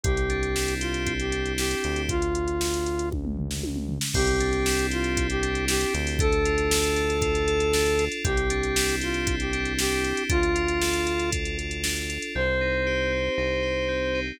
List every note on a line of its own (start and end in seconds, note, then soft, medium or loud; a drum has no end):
0.03 1.75 C2 loud
0.03 1.06 C4 loud
0.03 0.74 G4 medium
0.03 kick loud
0.03 closed hi-hat medium
0.17 closed hi-hat medium
0.30 1.32 D4 medium
0.30 closed hi-hat medium
0.43 closed hi-hat medium
0.56 1.57 E4 medium
0.56 snare loud
0.68 closed hi-hat medium
0.80 1.13 F4 medium
0.80 1.84 G4 medium
0.80 closed hi-hat medium
0.94 closed hi-hat medium
1.07 2.04 C4 medium
1.07 kick medium
1.07 closed hi-hat medium
1.20 1.53 G4 medium
1.20 closed hi-hat medium
1.32 2.05 D4 medium
1.32 closed hi-hat medium
1.46 closed hi-hat medium
1.58 2.07 E4 medium
1.58 2.02 G4 medium
1.58 snare loud
1.71 closed hi-hat medium
1.84 3.99 D2 loud
1.84 2.08 G4 medium
1.84 closed hi-hat medium
1.96 closed hi-hat medium
2.09 3.09 F4 medium
2.09 kick medium
2.09 closed hi-hat medium
2.22 closed hi-hat medium
2.35 closed hi-hat medium
2.48 closed hi-hat medium
2.61 snare loud
2.74 closed hi-hat medium
2.86 closed hi-hat medium
2.99 closed hi-hat medium
3.12 kick medium
3.12 high tom medium
3.25 mid tom medium
3.37 floor tom medium
3.51 snare medium
3.63 high tom medium
3.76 mid tom medium
3.89 floor tom medium
4.01 snare loud
4.14 5.85 C2 loud
4.14 5.17 C4 loud
4.14 4.87 G4 medium
4.14 kick loud
4.14 crash loud
4.27 closed hi-hat medium
4.40 5.42 D4 medium
4.40 closed hi-hat medium
4.53 closed hi-hat medium
4.66 5.68 E4 medium
4.66 snare loud
4.79 closed hi-hat medium
4.91 5.27 F4 medium
4.91 5.93 G4 medium
4.91 closed hi-hat medium
5.04 closed hi-hat medium
5.17 6.15 C4 medium
5.17 kick medium
5.17 closed hi-hat loud
5.30 5.65 G4 medium
5.30 closed hi-hat medium
5.42 6.15 D4 medium
5.42 closed hi-hat medium
5.55 closed hi-hat medium
5.68 6.17 E4 medium
5.68 5.94 G4 medium
5.68 snare loud
5.81 closed hi-hat medium
5.94 8.09 D2 loud
5.94 6.18 G4 medium
5.94 closed hi-hat medium
6.07 open hi-hat medium
6.19 6.96 D4 loud
6.19 8.05 A4 loud
6.19 kick loud
6.19 closed hi-hat loud
6.32 closed hi-hat medium
6.45 7.22 F4 medium
6.45 closed hi-hat medium
6.58 closed hi-hat medium
6.71 7.47 A4 medium
6.71 snare loud
6.84 closed hi-hat medium
6.96 7.73 D4 medium
6.96 closed hi-hat medium
7.10 closed hi-hat medium
7.22 7.99 F4 medium
7.22 kick medium
7.22 closed hi-hat medium
7.35 closed hi-hat medium
7.47 8.21 A4 medium
7.47 closed hi-hat medium
7.60 closed hi-hat medium
7.73 8.22 D4 medium
7.73 snare loud
7.86 closed hi-hat medium
7.99 8.24 F4 medium
7.99 closed hi-hat medium
8.12 closed hi-hat medium
8.24 10.13 C2 loud
8.24 9.27 C4 loud
8.24 8.96 G4 medium
8.24 kick loud
8.24 closed hi-hat loud
8.37 closed hi-hat medium
8.50 9.52 D4 loud
8.50 closed hi-hat medium
8.63 closed hi-hat medium
8.76 9.78 E4 medium
8.76 snare loud
8.89 closed hi-hat medium
9.01 9.35 F4 medium
9.01 10.03 G4 medium
9.01 closed hi-hat medium
9.14 closed hi-hat medium
9.27 10.25 C4 medium
9.27 kick medium
9.27 closed hi-hat loud
9.40 9.73 G4 medium
9.40 closed hi-hat medium
9.53 10.26 D4 loud
9.53 closed hi-hat medium
9.65 closed hi-hat medium
9.78 10.27 E4 medium
9.78 10.23 G4 medium
9.78 snare loud
10.04 10.28 G4 medium
10.04 closed hi-hat medium
10.17 closed hi-hat medium
10.29 12.19 D2 medium
10.29 11.06 D4 loud
10.29 11.30 F4 loud
10.29 kick loud
10.29 closed hi-hat loud
10.43 closed hi-hat medium
10.55 11.32 F4 medium
10.55 closed hi-hat medium
10.68 closed hi-hat medium
10.81 11.57 A4 medium
10.81 snare loud
10.93 closed hi-hat medium
11.07 11.84 D4 medium
11.07 closed hi-hat medium
11.19 closed hi-hat medium
11.32 12.09 F4 medium
11.32 kick medium
11.32 closed hi-hat loud
11.45 closed hi-hat medium
11.58 12.31 A4 medium
11.58 closed hi-hat medium
11.71 closed hi-hat medium
11.84 12.33 D4 medium
11.84 snare loud
11.96 closed hi-hat medium
12.10 12.34 F4 medium
12.10 closed hi-hat medium
12.22 closed hi-hat medium
12.35 13.29 C2 loud
12.35 13.12 C4 loud
12.35 14.20 C5 medium
12.61 13.37 D#4 medium
12.86 13.62 G4 medium
13.12 13.88 C4 medium
13.38 14.32 C2 medium
13.38 14.14 D#4 loud
13.63 14.36 G4 medium
13.88 14.37 C4 medium
14.14 14.39 D#4 loud